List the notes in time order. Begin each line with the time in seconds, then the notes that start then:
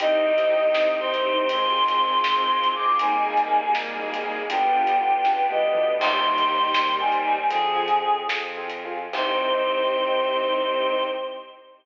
0.00 C2 C4 D#4 G4 D#5, kick, closed hi-hat
0.26 C4 D#4 G4
0.38 closed hi-hat
0.50 C4 D#4 G4
0.74 C2 C4 D#4 G4, snare
1.00 C4 D#4 G4 C5
1.14 closed hi-hat
1.26 C4 D#4 G4
1.49 G#1 G#3 C4 F4 G#4 C6, kick, closed hi-hat
1.88 closed hi-hat
2.24 G#1, snare
2.64 closed hi-hat
2.75 G#3 C4 D6
2.99 G#1 G3 A#3 D#4 G#4 G#5, kick, closed hi-hat
3.26 A#3 D#4 G#4
3.37 closed hi-hat
3.49 A#3 D#4 G#4
3.75 G#1 G#3 A#3 D#4 G#4, snare
3.99 A#3 D#4 G#4
4.14 closed hi-hat
4.26 A#3 D#4 G#4
4.50 G1 G3 B3 D4 F4 G4 G5, kick, closed hi-hat
4.75 B3 D4 F4 G4
4.87 closed hi-hat
5.01 B3 D4 F4 G4
5.25 C#2 B3 D4 F4 G4 B4, kick, snare
5.50 B3 D4 F4 G4 D#5, high tom
5.62 D2
5.75 B3 D4 F4 G4, mid tom
5.98 D#2 D#3 G3 C4 D#4 G4 C6, kick, crash
6.25 C4 D#4 G4
6.38 closed hi-hat
6.50 C4 D#4 G4
6.74 D#2 G3 C4 D#4 G4, snare
6.99 C4 D#4 G4 G#5
7.12 closed hi-hat
7.26 C4 D#4 G4
7.50 F2 D3 F3 C4 F4 G#4, kick, closed hi-hat
7.75 C4 F4 G#4
7.88 closed hi-hat
8.02 C4 F4 G#4
8.27 F2 C4 F4 G#4, snare
8.57 C4 F4 G#4
8.70 closed hi-hat
8.85 C4 F4 G#4
9.13 C2 C4 D#4 G4 C5, kick, crash